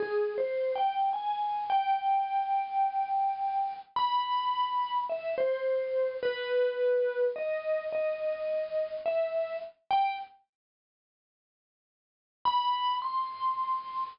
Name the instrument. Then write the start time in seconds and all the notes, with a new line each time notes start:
vibraphone
0.00 G#4
0.38 C5
0.75 G5
1.13 G#5
1.70 G5
3.96 B5
5.09 E5
5.38 C5
6.23 B4
7.36 D#5
7.92 D#5
9.06 E5
9.91 G5
12.45 B5
13.02 C6